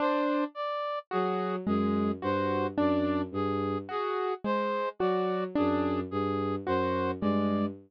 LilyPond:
<<
  \new Staff \with { instrumentName = "Violin" } { \clef bass \time 7/8 \tempo 4 = 54 r4 fis8 fis,8 g,8 fis,8 g,8 | r4 fis8 fis,8 g,8 fis,8 g,8 | }
  \new Staff \with { instrumentName = "Acoustic Grand Piano" } { \time 7/8 d'8 r8 fis'8 gis8 fis'8 d'8 r8 | fis'8 gis8 fis'8 d'8 r8 fis'8 gis8 | }
  \new Staff \with { instrumentName = "Brass Section" } { \time 7/8 c''8 d''8 gis'8 gis'8 c''8 d''8 gis'8 | gis'8 c''8 d''8 gis'8 gis'8 c''8 d''8 | }
>>